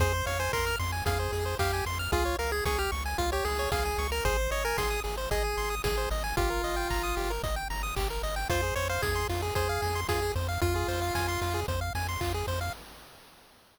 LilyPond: <<
  \new Staff \with { instrumentName = "Lead 1 (square)" } { \time 4/4 \key f \minor \tempo 4 = 113 c''8 des''16 c''16 bes'8 r8 aes'4 g'8 r8 | f'8 bes'16 aes'16 aes'16 g'16 r8 f'16 g'16 aes'8 aes'8. bes'16 | c''8 des''16 bes'16 aes'8 r8 aes'4 aes'8 r8 | f'2 r2 |
c''8 des''16 c''16 aes'8 r8 aes'4 aes'8 r8 | f'2 r2 | }
  \new Staff \with { instrumentName = "Lead 1 (square)" } { \time 4/4 \key f \minor aes'16 c''16 f''16 aes''16 c'''16 f'''16 c'''16 aes''16 f''16 c''16 aes'16 c''16 f''16 aes''16 c'''16 f'''16 | aes'16 des''16 f''16 aes''16 des'''16 f'''16 des'''16 aes''16 f''16 des''16 aes'16 des''16 f''16 aes''16 des'''16 f'''16 | aes'16 c''16 ees''16 aes''16 c'''16 ees'''16 aes'16 c''16 ees''16 aes''16 c'''16 ees'''16 aes'16 c''16 ees''16 aes''16 | g'16 bes'16 ees''16 g''16 bes''16 ees'''16 g'16 bes'16 ees''16 g''16 bes''16 ees'''16 g'16 bes'16 ees''16 g''16 |
f'16 aes'16 c''16 f''16 aes''16 c'''16 f'16 aes'16 c''16 f''16 aes''16 c'''16 f'16 aes'16 c''16 f''16 | f'16 aes'16 c''16 f''16 aes''16 c'''16 f'16 aes'16 c''16 f''16 aes''16 c'''16 f'16 aes'16 c''16 f''16 | }
  \new Staff \with { instrumentName = "Synth Bass 1" } { \clef bass \time 4/4 \key f \minor f,8 f,8 f,8 f,8 f,8 f,8 f,8 f,8 | des,8 des,8 des,8 des,8 des,8 des,8 des,8 des,8 | aes,,8 aes,,8 aes,,8 aes,,8 aes,,8 aes,,8 aes,,8 aes,,8 | g,,8 g,,8 g,,8 g,,8 g,,8 g,,8 g,,8 g,,8 |
f,8 f,8 f,8 f,8 f,8 f,8 f,8 f,8 | f,8 f,8 f,8 f,8 f,8 f,8 f,8 f,8 | }
  \new DrumStaff \with { instrumentName = "Drums" } \drummode { \time 4/4 <hh bd>8 hho8 <hc bd>8 hho8 <hh bd>8 hho8 <hc bd>8 hho8 | <hh bd>8 hho8 <bd sn>8 hho8 <hh bd>8 hho8 <bd sn>8 hho8 | <hh bd>8 hho8 <bd sn>8 hho8 <hh bd>8 hho8 <bd sn>8 hho8 | <hh bd>8 hho8 <hc bd>8 hho8 <hh bd>8 hho8 <hc bd>8 hho8 |
<hh bd>8 hho8 <bd sn>8 hho8 <hh bd>8 hho8 <bd sn>8 hho8 | <hh bd>8 hho8 <bd sn>8 hho8 <hh bd>8 hho8 <hc bd>8 hho8 | }
>>